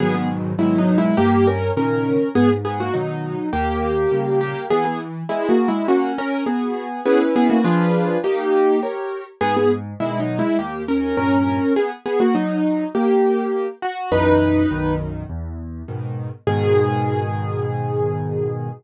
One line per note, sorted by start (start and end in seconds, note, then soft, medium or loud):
0.00 0.53 G#2 loud
0.00 0.53 B2 loud
0.00 0.53 D#3 medium
0.00 0.53 F#3 medium
0.00 0.14 B3 medium
0.00 0.14 G#4 loud
0.14 0.28 B3 medium
0.14 0.28 G#4 medium
0.59 1.12 G#2 medium
0.59 1.12 B2 medium
0.59 1.12 D#3 medium
0.59 1.12 F#3 loud
0.59 0.77 G#3 medium
0.59 0.77 E4 medium
0.78 0.97 F#3 medium
0.78 0.97 D#4 medium
0.98 1.17 G#3 medium
0.98 1.17 E4 medium
1.17 1.71 G2 medium
1.17 1.46 A#3 medium
1.17 1.46 G4 loud
1.47 1.71 C#4 medium
1.47 1.71 A#4 medium
1.77 2.18 A#2 medium
1.77 2.18 C#3 medium
1.77 2.18 D#3 medium
1.77 2.29 C#4 medium
1.77 2.29 A#4 medium
2.35 2.88 G#2 loud
2.35 2.49 B3 medium
2.35 2.49 G#4 loud
2.65 2.79 B3 medium
2.65 2.79 G#4 medium
2.80 2.94 A#3 medium
2.80 2.94 F#4 medium
2.94 3.35 B2 medium
2.94 3.35 D#3 medium
2.94 3.49 F#3 medium
2.94 3.49 D#4 medium
3.53 4.06 D#2 medium
3.53 4.39 A#3 medium
3.53 4.39 G4 medium
4.12 4.53 A#2 medium
4.12 4.53 C#3 medium
4.12 4.53 G3 medium
4.41 4.66 A#3 medium
4.41 4.66 G4 medium
4.70 5.24 E3 loud
4.70 4.84 B3 medium
4.70 4.84 G#4 loud
4.85 4.99 B3 medium
4.85 4.99 G#4 medium
5.29 5.48 G#3 medium
5.29 5.71 B3 medium
5.29 5.48 E4 medium
5.29 5.71 G#4 medium
5.49 5.68 A#3 medium
5.49 5.68 F#4 medium
5.68 5.87 G#3 medium
5.68 5.87 E4 medium
5.88 6.12 A#3 medium
5.88 6.41 C#4 loud
5.88 6.12 F#4 medium
6.18 6.44 C#4 medium
6.18 6.44 A#4 medium
6.46 7.01 B3 medium
6.46 6.88 F#4 medium
6.46 7.01 G#4 medium
7.06 7.19 B3 medium
7.06 7.59 C#4 medium
7.06 7.59 E4 medium
7.06 7.19 G#4 medium
7.06 7.59 B4 loud
7.36 7.50 B3 medium
7.36 7.50 G#4 medium
7.50 7.64 A#3 medium
7.50 7.64 F#4 medium
7.64 8.17 F3 medium
7.64 8.17 D4 medium
7.64 8.17 F4 medium
7.64 8.17 G#4 medium
7.64 8.17 B4 loud
8.24 8.80 A#3 medium
8.24 8.76 D#4 loud
8.24 8.80 G4 medium
8.83 9.24 G4 medium
8.83 9.24 A#4 medium
8.83 9.24 C#5 medium
9.41 9.94 G#2 loud
9.41 9.55 B3 loud
9.41 9.55 G#4 loud
9.57 9.71 B3 medium
9.57 9.71 G#4 medium
10.00 10.41 B2 medium
10.00 10.41 D#3 medium
10.00 10.19 G#3 medium
10.00 10.19 E4 medium
10.20 10.38 F#3 medium
10.20 10.38 D#4 medium
10.39 10.58 G#3 medium
10.39 10.58 E4 medium
10.59 11.12 D#2 medium
10.59 10.82 A#3 medium
10.59 10.82 G4 medium
10.88 11.16 C#4 medium
10.88 11.16 A#4 medium
11.17 11.59 G2 medium
11.17 11.59 A#2 medium
11.17 11.73 C#4 medium
11.17 11.73 A#4 medium
11.76 11.90 B3 medium
11.76 11.90 G#4 medium
12.06 12.20 B3 medium
12.06 12.20 G#4 medium
12.20 12.34 A#3 medium
12.20 12.34 F#4 medium
12.35 12.84 F#3 medium
12.35 12.84 D#4 medium
12.95 13.67 A#3 medium
12.95 13.67 G4 medium
13.82 14.10 F#4 loud
14.12 14.65 B1 medium
14.12 14.65 F#2 medium
14.12 14.65 E3 medium
14.12 14.94 D#4 medium
14.12 14.94 B4 loud
14.71 15.24 B1 medium
14.71 15.24 F#2 medium
14.71 15.24 D#3 medium
15.30 15.82 E2 medium
15.88 16.29 G#2 medium
15.88 16.29 B2 medium
15.88 16.29 D#3 medium
16.47 18.69 G#2 loud
16.47 18.69 B2 loud
16.47 18.69 D#3 loud
16.47 18.69 G#4 loud